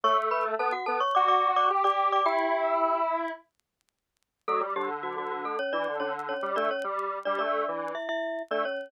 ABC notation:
X:1
M:4/4
L:1/16
Q:1/4=108
K:Edor
V:1 name="Glockenspiel"
[cc'] z [Bb] z [Aa] [Ff] [Aa] [cc'] [dd'] [dd']2 [dd'] z [dd']2 [dd'] | [Gg]6 z10 | [A,A] z [G,G] z [F,F] [F,F] [F,F] [A,A] [Cc] [Dd]2 [Cc] z [Cc]2 [Dd] | [Cc] z3 [Dd] [Dd]4 [Ee] [Ee]3 [Dd] [Cc]2 |]
V:2 name="Lead 1 (square)"
A,4 B, z B, z F4 G G3 | E8 z8 | F, G, D,3 D,3 z E, D, D,3 G, A, | z G,3 G, A,2 E,2 z4 A, z2 |]